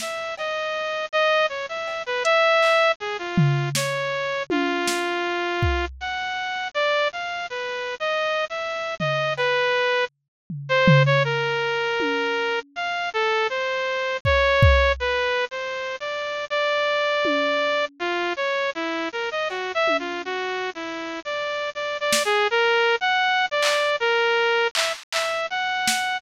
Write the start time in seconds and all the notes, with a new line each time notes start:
0.00 E5, snare
0.38 D#5, cowbell
1.12 D#5
1.49 C#5
1.69 E5
1.88 cowbell
2.06 B4
2.24 E5, closed hi-hat
2.62 clap
3.00 G#4
3.19 F4
3.38 floor tom
3.75 C#5, snare
4.50 F4, high tom
4.88 snare
5.62 kick
6.01 F#5
6.74 D5
7.12 F5
7.50 B4
8.00 D#5
8.50 E5
9.00 D#5, floor tom
9.37 B4, cowbell
10.50 floor tom
10.69 C5
10.88 floor tom
11.06 C#5
11.24 A#4
12.00 high tom
12.76 F5
13.13 A4
13.50 C5
14.25 C#5, kick
14.62 kick
15.00 B4
15.51 C5
16.00 D5
16.50 D5
17.25 high tom
17.99 F4
18.37 C#5
18.75 E4
19.12 A#4
19.31 D#5
19.50 F#4, cowbell
19.75 E5
19.88 high tom
19.99 F4
20.25 F#4
20.75 E4
21.25 D5
21.75 D5
22.00 D5
22.12 snare
22.25 G#4
22.51 A#4
23.01 F#5
23.51 D5
23.62 clap
24.00 A#4
24.75 E5, clap
25.12 E5, clap
25.50 F#5
25.88 snare